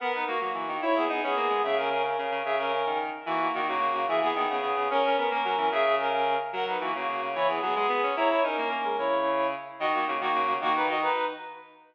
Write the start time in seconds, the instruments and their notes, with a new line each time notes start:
0.00 lead 1 (square) B3, clarinet A#4 F#5
0.14 clarinet D#4 B4
0.27 clarinet A#3 F#4, lead 1 (square) A#3
0.41 lead 1 (square) F#3, clarinet A#3 F#4
0.54 lead 1 (square) E3
0.68 lead 1 (square) D#3
0.82 clarinet E4 C#5, lead 1 (square) E4
0.95 clarinet B3 G#4
1.09 clarinet B3 G#4, lead 1 (square) D#4
1.23 clarinet B3 G#4, lead 1 (square) C#4
1.36 lead 1 (square) A#3
1.49 lead 1 (square) G#3
1.63 lead 1 (square) C#3, clarinet G#4 E5
1.77 clarinet C#4 A#4
1.90 lead 1 (square) C#3, clarinet C#4 A#4
2.03 lead 1 (square) C#3, clarinet C#4 A#4
2.18 lead 1 (square) C#3
2.31 lead 1 (square) C#3
2.45 lead 1 (square) C#3, clarinet G#4 E5
2.59 clarinet C#4 A#4
2.72 clarinet C#4 A#4
2.86 lead 1 (square) D#3
3.26 lead 1 (square) E3, clarinet A#3 F#4
3.40 clarinet A#3 F#4
3.54 lead 1 (square) D#3, clarinet A#3 F#4
3.67 lead 1 (square) C#3, clarinet A#3 F#4
3.81 lead 1 (square) C#3
3.94 lead 1 (square) C#3
4.08 lead 1 (square) E3, clarinet G#4 E5
4.22 clarinet B3 G#4
4.35 lead 1 (square) D#3, clarinet B3 G#4
4.49 lead 1 (square) C#3, clarinet B3 G#4
4.62 lead 1 (square) C#3
4.76 lead 1 (square) C#3
4.90 clarinet C#4 A#4, lead 1 (square) C#4
5.03 clarinet C#4 A#4
5.17 lead 1 (square) B3, clarinet C#4 A#4
5.30 lead 1 (square) A#3, clarinet C#4 A#4
5.45 lead 1 (square) F#3
5.57 lead 1 (square) E3
5.71 lead 1 (square) C#3, clarinet G#4 E5
5.99 clarinet C#4 A#4
6.53 lead 1 (square) F#3, clarinet A#4 F#5
6.67 clarinet D#4 B4
6.80 lead 1 (square) E3, clarinet A#3 F#4
6.94 lead 1 (square) C#3, clarinet A#3 F#4
7.08 lead 1 (square) C#3
7.22 lead 1 (square) C#3
7.35 lead 1 (square) E3, clarinet E4 C#5
7.48 clarinet B3 G#4
7.62 lead 1 (square) F#3, clarinet B3 G#4
7.75 lead 1 (square) G#3, clarinet B3 G#4
7.89 lead 1 (square) B3
8.03 lead 1 (square) C#4
8.16 lead 1 (square) E4, clarinet C#5 A#5
8.30 clarinet E4 C#5
8.43 clarinet C#4 A#4, lead 1 (square) D#4
8.57 lead 1 (square) A#3, clarinet C#4 A#4
8.71 lead 1 (square) A#3
8.85 lead 1 (square) G#3
8.98 lead 1 (square) C#3, clarinet E4 C#5
9.80 lead 1 (square) D#3, clarinet F#4 D#5
9.93 clarinet A#3 F#4
10.07 lead 1 (square) C#3, clarinet A#3 F#4
10.20 lead 1 (square) D#3, clarinet A#3 F#4
10.35 lead 1 (square) C#3
10.47 lead 1 (square) C#3
10.61 lead 1 (square) D#3, clarinet A#3 F#4
10.75 clarinet D#4 B4
10.88 clarinet F#4 D#5
11.02 clarinet D#4 B4